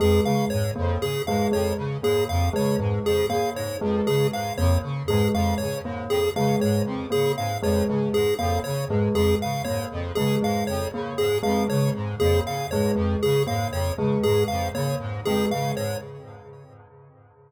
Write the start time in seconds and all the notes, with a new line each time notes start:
0.00 F2 G#3 G#4
0.24 C#3 G#3 F5
0.50 G#2 C#5
0.76 F2 A#3
1.01 C#3 G#4
1.27 G#2 G#3 F5
1.52 F2 G#3 C#5
1.77 C#3
2.03 G#2 A#3 G#4
2.29 F2 F5
2.53 C#3 G#3 C#5
2.79 G#2 G#3
3.05 F2 G#4
3.29 C#3 A#3 F5
3.56 G#2 C#5
3.81 F2 G#3
4.07 C#3 G#3 G#4
4.32 G#2 F5
4.58 F2 A#3 C#5
4.83 C#3
5.08 G#2 G#3 G#4
5.34 F2 G#3 F5
5.58 C#3 C#5
5.84 G#2 A#3
6.09 F2 G#4
6.35 C#3 G#3 F5
6.60 G#2 G#3 C#5
6.86 F2
7.10 C#3 A#3 G#4
7.37 G#2 F5
7.63 F2 G#3 C#5
7.89 C#3 G#3
8.14 G#2 G#4
8.39 F2 A#3 F5
8.64 C#3 C#5
8.89 G#2 G#3
9.14 F2 G#3 G#4
9.42 C#3 F5
9.65 G#2 A#3 C#5
9.92 F2
10.15 C#3 G#3 G#4
10.42 G#2 G#3 F5
10.67 F2 C#5
10.93 C#3 A#3
11.18 G#2 G#4
11.43 F2 G#3 F5
11.68 C#3 G#3 C#5
11.95 G#2
12.20 F2 A#3 G#4
12.45 C#3 F5
12.71 G#2 G#3 C#5
12.95 F2 G#3
13.23 C#3 G#4
13.47 G#2 A#3 F5
13.72 F2 C#5
13.97 C#3 G#3
14.23 G#2 G#3 G#4
14.48 F2 F5
14.75 C#3 A#3 C#5
15.00 G#2
15.25 F2 G#3 G#4
15.51 C#3 G#3 F5
15.76 G#2 C#5